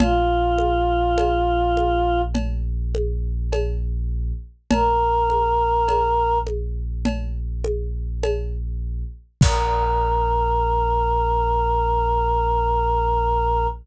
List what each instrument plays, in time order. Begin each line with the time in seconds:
0.00 synth bass 2 A#1, choir aahs F4, cowbell, low conga
0.58 high conga
1.18 cowbell, high conga
1.77 high conga
2.35 cowbell, low conga
2.95 high conga
3.52 cowbell, high conga
4.71 synth bass 2 A#1, choir aahs A#4, cowbell, low conga
5.30 high conga
5.88 cowbell, high conga
6.47 high conga
7.05 cowbell, low conga
7.64 high conga
8.23 cowbell, high conga
9.41 synth bass 2 A#1, choir aahs A#4, kick, crash